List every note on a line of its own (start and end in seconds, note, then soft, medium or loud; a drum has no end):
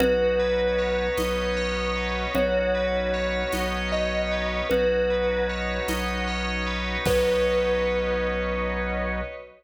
0.00 1.08 B1 loud
0.00 2.33 B3 medium
0.00 2.33 C#4 medium
0.00 2.33 D#4 medium
0.00 2.33 F#4 medium
0.00 2.24 F#4 loud
0.00 2.22 B4 medium
0.00 low conga loud
0.40 1.96 B4 medium
0.78 1.56 C#5 medium
1.17 2.26 B1 medium
1.17 2.29 D#5 loud
1.17 tambourine medium
1.17 high conga loud
1.57 2.31 C#5 loud
1.96 2.33 B4 medium
2.35 3.43 B1 loud
2.35 4.68 B3 medium
2.35 4.68 C#4 medium
2.35 4.68 D#4 medium
2.35 4.68 F#4 medium
2.35 4.59 F#4 loud
2.35 3.72 C#5 medium
2.35 low conga loud
2.75 4.31 B4 medium
3.14 3.92 C#5 medium
3.52 4.61 B1 medium
3.52 4.65 D#5 medium
3.52 tambourine medium
3.52 high conga medium
3.92 4.67 C#5 medium
3.92 4.58 D#5 medium
4.31 4.69 B4 medium
4.70 5.79 B1 medium
4.70 7.04 B3 medium
4.70 7.04 C#4 medium
4.70 7.04 D#4 medium
4.70 7.04 F#4 medium
4.70 6.95 F#4 loud
4.70 5.43 B4 medium
4.70 low conga loud
5.10 6.66 B4 medium
5.49 6.27 C#5 medium
5.88 6.97 B1 medium
5.88 7.00 D#5 medium
5.88 tambourine loud
5.88 high conga loud
6.28 7.02 C#5 loud
6.67 7.04 B4 medium
7.05 9.21 B1 loud
7.05 9.21 B3 loud
7.05 9.21 C#4 loud
7.05 9.21 D#4 loud
7.05 9.21 F#4 loud
7.05 9.21 F#4 medium
7.05 9.21 B4 loud
7.05 9.22 B4 loud
7.05 9.21 C#5 loud
7.05 9.21 D#5 loud
7.05 kick loud
7.05 crash loud